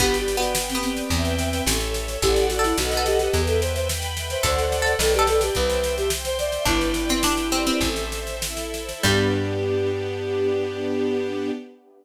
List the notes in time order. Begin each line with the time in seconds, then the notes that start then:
0.00 G1 B3 G4 B4 D5 G5, kick, snare
0.14 snare
0.19 G4
0.28 D5, snare
0.37 B3 F#4
0.42 snare
0.55 G4 B4 G5, snare
0.69 C4, snare
0.75 B3
0.83 C4 D5, snare
0.97 snare
1.10 E2 B4 E5 G5, kick, snare
1.25 snare
1.39 snare
1.53 snare
1.66 A1 A4 C#5 E5, snare
1.81 snare
1.93 C#5, snare
2.08 snare
2.21 A1 G4 A4 D5 F#5, kick, snare
2.36 snare
2.50 F#4, snare
2.59 A4
2.64 E4, snare
2.78 B1 F#4 A4 B4 D#5 F#5, snare
2.91 snare
2.97 A4
3.06 G4, snare
3.19 G4, snare
3.33 E2 B4 E5 G5, kick, snare
3.47 A4, snare
3.61 C5 E5, snare
3.75 C5, snare
3.88 B4 G5 B5, snare
4.02 snare
4.16 E5, snare
4.30 C5, snare
4.43 D2 A4 C5 D5 F#5, kick, snare
4.58 snare
4.72 snare
4.82 A4
4.86 snare
4.99 B1 A4 B4 D5 G5, snare
5.14 G4, snare
5.19 A4
5.27 A4, snare
5.41 G4, snare
5.55 C2 B4 C5 E5 G5, kick, snare
5.70 snare
5.83 E5, snare
5.97 G4, snare
6.10 C5 G5 C6, snare
6.25 C5, snare
6.39 D5 E5, snare
6.52 snare
6.65 G1 D4 E4 B4 D5 G5, kick, snare
6.81 snare
6.94 D5, snare
7.09 C4, snare
7.22 D4 G4 B4 G5, snare
7.37 snare
7.51 C4 D5, snare
7.66 C4, snare
7.81 A1 A4 C5 E5, kick, snare
7.96 snare
8.11 C5, snare
8.27 snare
8.41 E4 A4 E5, snare
8.57 snare
8.74 C5, snare
8.89 snare
9.03 G2 G3 B3 D4 G4, kick, crash